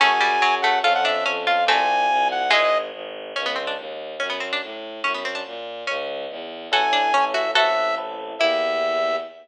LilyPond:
<<
  \new Staff \with { instrumentName = "Lead 2 (sawtooth)" } { \time 2/2 \key e \mixolydian \tempo 2 = 143 gis''2. fis''4 | f''8 fis''8 e''4 r4 f''4 | gis''2. fis''4 | dis''4. r2 r8 |
\key g \mixolydian r1 | r1 | r1 | r1 |
\key e \mixolydian gis''2. e''4 | e''2 r2 | e''1 | }
  \new Staff \with { instrumentName = "Pizzicato Strings" } { \time 2/2 \key e \mixolydian <a cis'>4 g4 fis4 a4 | <f' a'>4 d'4 cis'4 f'4 | <a c'>2. r4 | <e gis>4. r2 r8 |
\key g \mixolydian cis'8 b8 c'8 d'8 r2 | cis'8 b8 c'8 d'8 r2 | cis'8 b8 c'8 d'8 r2 | cis'2~ cis'8 r4. |
\key e \mixolydian <fis' a'>4 d'4 cis'4 fis'4 | <fis' a'>2 r2 | e'1 | }
  \new Staff \with { instrumentName = "Electric Piano 1" } { \time 2/2 \key e \mixolydian <cis' fis' gis'>1 | <cis' f' a'>1 | <c' f' g'>1 | r1 |
\key g \mixolydian r1 | r1 | r1 | r1 |
\key e \mixolydian <cis' e' a'>2 <cis' e' a'>2 | <c' e' a'>2 <c' e' a'>2 | <bes e' g'>1 | }
  \new Staff \with { instrumentName = "Violin" } { \clef bass \time 2/2 \key e \mixolydian fis,2 fis,2 | f,2 f,2 | c,2 c,2 | gis,,2 gis,,2 |
\key g \mixolydian cis,2 dis,2 | fis,2 a,2 | fis,2 ais,2 | cis,2 e,2 |
\key e \mixolydian a,,1 | a,,1 | e,1 | }
>>